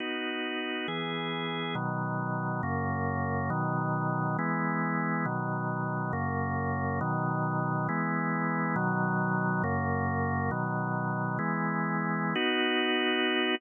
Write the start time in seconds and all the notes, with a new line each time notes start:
0.00 B3 D#4 F#4
0.88 E3 B3 G#4
1.75 B2 D#3 F#3
2.63 F#2 C#3 A#3
3.50 B2 D#3 F#3
4.39 E3 G#3 B3
5.25 B2 D#3 F#3
6.13 F#2 C#3 A#3
7.01 B2 D#3 F#3
7.89 E3 G#3 B3
8.76 B2 D#3 F#3
9.64 F#2 C#3 A#3
10.51 B2 D#3 F#3
11.39 E3 G#3 B3
12.35 B3 D#4 F#4